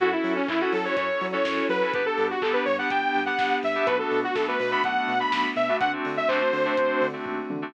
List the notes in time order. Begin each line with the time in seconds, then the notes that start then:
0.00 F#2 C#4 E4 F#4 A4, kick, closed hi-hat
0.12 C#4 E4 F#4 A4
0.24 F#3, open hi-hat
0.36 C#4
0.48 F#2 C#4 E4 F#4 A4, kick, clap
0.60 C#4 E4 F#4 A4
0.73 F#3 A4, open hi-hat
0.84 C#4 E4 F#4 A4 C#5
0.96 F#2 C#4 E4 F#4 A4 C#5, kick, closed hi-hat
1.21 F#3, open hi-hat
1.32 C#4 E4 F#4 A4 C#5
1.45 F#2, kick, snare
1.69 F#3 B4, open hi-hat
1.81 C#4 E4 F#4 A4
1.93 G1 B3 D4 G4 B4, kick, closed hi-hat
2.06 B3 D4 G4 A4
2.18 G2, open hi-hat
2.30 F#4
2.42 G1 B3 D4 G4 A4, kick, clap
2.53 B3 D4 G4 B4
2.65 G2 C#5, open hi-hat
2.78 B3 D4 G4 F#5
2.90 G1 B3 D4 G4 G5, kick, closed hi-hat
3.15 G2, open hi-hat
3.26 B3 D4 G4 F#5
3.39 G1, kick, snare
3.63 G2 E5, open hi-hat
3.75 B3 D4 G4
3.86 B1 A3 B3 D4 F#4 B4, kick, closed hi-hat
3.99 A3 B3 D4 F#4 A4
4.11 B2, open hi-hat
4.24 F#4
4.35 B1 A3 B3 D4 F#4 A4, kick, snare
4.48 A3 B3 D4 F#4 B4
4.59 B2 B4, open hi-hat
4.71 A3 B3 D4 F#4 B5
4.84 B1 A3 B3 D4 F#4 F#5, kick, closed hi-hat
5.08 B2, open hi-hat
5.20 A3 B3 D4 F#4 B5
5.32 B1, kick, snare
5.56 B2 E5, open hi-hat
5.69 A3 B3 D4 F#4
5.80 D2 A3 C4 D4 F#4 F#5, kick, closed hi-hat
5.93 A3 C4 D4 F#4
6.05 D3, open hi-hat
6.17 E5
6.28 D2 A3 C4 D4 F#4 C5, kick, clap
6.41 A3 C4 D4 F#4
6.53 D3, open hi-hat
6.65 A3 C4 D4 F#4
6.77 D2 A3 C4 D4 F#4, kick, closed hi-hat
7.01 D3, open hi-hat
7.13 A3 C4 D4 F#4
7.26 D#2, kick, floor tom
7.50 D3, high tom
7.62 A3 C4 D4 F#4